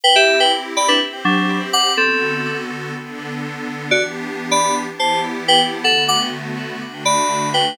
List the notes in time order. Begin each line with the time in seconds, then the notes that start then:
0.03 C4 E4 G4 B4 G5
0.16 G4 E5
0.40 B4 G5
0.77 D5 B5
0.88 D4 B4
1.00 C4 G4 C5
1.25 F#3 D4
1.73 F#5 D6
1.97 D3 B3 C4 F#4 A4
2.94 D3 B3 D4 A4
3.91 E3 B3 D4 F#4 G4 D5
4.51 D5 B5
4.87 E3 B3 E4 G4
4.99 C5 A5
5.48 B4 G5
5.84 D3 A3 B3 F#4 A4 F#5
6.08 F#5 D6
6.81 D3 A3 D4 F#4
7.05 D5 B5
7.54 B4 G5